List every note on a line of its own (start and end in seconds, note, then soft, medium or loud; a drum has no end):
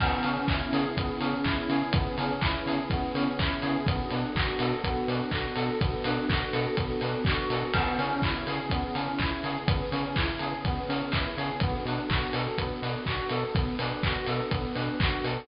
0.00 0.13 C#2 loud
0.00 0.97 B3 loud
0.00 1.92 B3 medium
0.00 1.92 C#4 medium
0.00 1.92 E4 medium
0.00 1.92 G#4 medium
0.00 kick loud
0.00 crash loud
0.23 0.38 C#3 medium
0.23 1.20 C#4 loud
0.23 open hi-hat medium
0.48 0.62 C#2 medium
0.48 1.44 E4 medium
0.48 kick loud
0.48 clap loud
0.73 0.86 C#3 medium
0.73 1.70 G#4 medium
0.73 open hi-hat medium
0.97 1.10 C#2 medium
0.97 1.93 B3 loud
0.97 kick loud
0.97 closed hi-hat loud
1.20 1.34 C#3 medium
1.20 2.18 C#4 medium
1.20 open hi-hat medium
1.44 1.58 C#2 medium
1.44 2.41 E4 medium
1.44 kick medium
1.44 clap loud
1.69 1.83 C#3 medium
1.69 2.66 G#4 medium
1.69 open hi-hat medium
1.93 2.07 C#2 medium
1.93 2.90 B3 loud
1.93 3.85 B3 medium
1.93 3.85 C#4 medium
1.93 3.85 G#4 medium
1.93 3.85 B4 medium
1.93 kick loud
1.93 closed hi-hat loud
2.18 2.31 C#3 medium
2.18 3.14 C#4 medium
2.18 open hi-hat medium
2.41 2.55 C#2 medium
2.41 3.39 E4 medium
2.41 kick loud
2.41 clap loud
2.66 2.79 C#3 medium
2.66 3.61 G#4 medium
2.66 open hi-hat medium
2.90 3.04 C#2 medium
2.90 3.83 B3 loud
2.90 kick loud
2.90 closed hi-hat loud
3.15 3.28 C#3 medium
3.15 3.84 C#4 medium
3.15 open hi-hat medium
3.39 3.52 C#2 medium
3.39 3.85 E4 medium
3.39 kick loud
3.39 clap loud
3.62 3.76 C#3 medium
3.62 3.85 G#4 medium
3.62 open hi-hat medium
3.86 4.00 B1 loud
3.86 4.84 B3 loud
3.86 5.78 B3 medium
3.86 5.78 D4 medium
3.86 5.78 F#4 medium
3.86 5.78 A4 medium
3.86 kick loud
3.86 closed hi-hat loud
4.10 4.24 B2 medium
4.10 5.08 D4 medium
4.10 open hi-hat medium
4.35 4.49 B1 medium
4.35 5.32 F#4 medium
4.35 kick loud
4.35 clap loud
4.59 4.73 B2 medium
4.59 5.55 A4 medium
4.59 open hi-hat loud
4.84 4.97 B1 medium
4.84 5.80 B3 loud
4.84 kick medium
4.84 closed hi-hat loud
5.08 5.21 B2 medium
5.08 6.04 D4 medium
5.08 open hi-hat medium
5.31 5.46 B1 medium
5.31 6.29 F#4 medium
5.31 kick medium
5.31 clap loud
5.56 5.70 B2 medium
5.56 6.52 A4 medium
5.56 open hi-hat medium
5.81 5.94 B1 medium
5.81 6.76 B3 medium
5.81 7.72 B3 medium
5.81 7.72 D4 medium
5.81 7.72 A4 medium
5.81 7.72 B4 medium
5.81 kick loud
5.81 closed hi-hat loud
6.04 6.18 B2 medium
6.04 7.01 D4 medium
6.04 open hi-hat loud
6.29 6.42 B1 medium
6.29 7.25 F#4 medium
6.29 kick loud
6.29 clap loud
6.53 6.66 B2 medium
6.53 7.50 A4 medium
6.53 open hi-hat medium
6.77 6.91 B1 medium
6.77 7.69 B3 medium
6.77 kick loud
6.77 closed hi-hat loud
7.01 7.15 B2 medium
7.01 7.71 D4 medium
7.01 open hi-hat medium
7.25 7.39 B1 medium
7.25 7.72 F#4 medium
7.25 kick loud
7.25 clap loud
7.50 7.63 B2 medium
7.50 7.74 A4 medium
7.50 open hi-hat medium
7.73 7.88 C#2 loud
7.73 9.65 B3 medium
7.73 7.99 B3 loud
7.73 9.65 C#4 medium
7.73 9.65 E4 medium
7.73 9.65 G#4 medium
7.73 kick loud
7.73 crash loud
7.98 8.12 C#3 medium
7.98 8.23 C#4 loud
7.98 open hi-hat medium
8.22 8.36 C#2 medium
8.22 8.47 E4 medium
8.22 kick loud
8.22 clap loud
8.47 8.60 C#3 medium
8.47 8.71 G#4 medium
8.47 open hi-hat medium
8.70 8.84 C#2 medium
8.70 8.96 B3 loud
8.70 kick loud
8.70 closed hi-hat loud
8.95 9.08 C#3 medium
8.95 9.20 C#4 medium
8.95 open hi-hat medium
9.18 9.33 C#2 medium
9.18 9.43 E4 medium
9.18 kick medium
9.18 clap loud
9.44 9.57 C#3 medium
9.44 9.68 G#4 medium
9.44 open hi-hat medium
9.67 9.81 C#2 medium
9.67 9.91 B3 loud
9.67 11.59 B3 medium
9.67 11.59 C#4 medium
9.67 11.59 G#4 medium
9.67 11.59 B4 medium
9.67 kick loud
9.67 closed hi-hat loud
9.91 10.05 C#3 medium
9.91 10.16 C#4 medium
9.91 open hi-hat medium
10.16 10.29 C#2 medium
10.16 10.41 E4 medium
10.16 kick loud
10.16 clap loud
10.39 10.54 C#3 medium
10.39 10.65 G#4 medium
10.39 open hi-hat medium
10.64 10.78 C#2 medium
10.64 10.90 B3 loud
10.64 kick loud
10.64 closed hi-hat loud
10.88 11.02 C#3 medium
10.88 11.12 C#4 medium
10.88 open hi-hat medium
11.12 11.26 C#2 medium
11.12 11.37 E4 medium
11.12 kick loud
11.12 clap loud
11.37 11.50 C#3 medium
11.37 11.60 G#4 medium
11.37 open hi-hat medium
11.60 11.75 B1 loud
11.60 11.86 B3 loud
11.60 13.53 B3 medium
11.60 13.53 D4 medium
11.60 13.53 F#4 medium
11.60 13.53 A4 medium
11.60 kick loud
11.60 closed hi-hat loud
11.85 11.99 B2 medium
11.85 12.10 D4 medium
11.85 open hi-hat medium
12.10 12.23 B1 medium
12.10 12.35 F#4 medium
12.10 kick loud
12.10 clap loud
12.33 12.47 B2 medium
12.33 12.58 A4 medium
12.33 open hi-hat loud
12.58 12.71 B1 medium
12.58 12.83 B3 loud
12.58 kick medium
12.58 closed hi-hat loud
12.82 12.96 B2 medium
12.82 13.07 D4 medium
12.82 open hi-hat medium
13.06 13.20 B1 medium
13.06 13.32 F#4 medium
13.06 kick medium
13.06 clap loud
13.29 13.44 B2 medium
13.29 13.55 A4 medium
13.29 open hi-hat medium
13.54 13.68 B1 medium
13.54 13.79 B3 medium
13.54 15.47 B3 medium
13.54 15.47 D4 medium
13.54 15.47 A4 medium
13.54 15.47 B4 medium
13.54 kick loud
13.54 closed hi-hat loud
13.79 13.92 B2 medium
13.79 14.04 D4 medium
13.79 open hi-hat loud
14.03 14.17 B1 medium
14.03 14.28 F#4 medium
14.03 kick loud
14.03 clap loud
14.26 14.41 B2 medium
14.26 14.52 A4 medium
14.26 open hi-hat medium
14.51 14.65 B1 medium
14.51 14.75 B3 medium
14.51 kick loud
14.51 closed hi-hat loud
14.75 14.89 B2 medium
14.75 14.99 D4 medium
14.75 open hi-hat medium
15.00 15.13 B1 medium
15.00 15.24 F#4 medium
15.00 kick loud
15.00 clap loud
15.24 15.37 B2 medium
15.24 15.47 A4 medium
15.24 open hi-hat medium